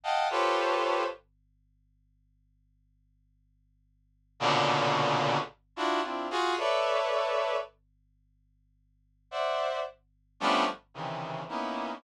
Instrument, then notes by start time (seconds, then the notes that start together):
brass section
0.03 D#5 F5 F#5 G5 A5
0.30 F4 G4 A4 B4 C5 C#5
4.40 A#2 B2 C#3 D3
5.76 D4 E4 F4 F#4
6.03 C4 D4 E4 F4
6.30 F4 F#4 G#4
6.58 A4 B4 C#5 D5 E5
9.31 C5 D5 E5 F#5
10.40 F3 G3 A3 B3 C#4 D4
10.94 C3 C#3 D#3 E3
11.49 A#3 B3 C#4 D#4 E4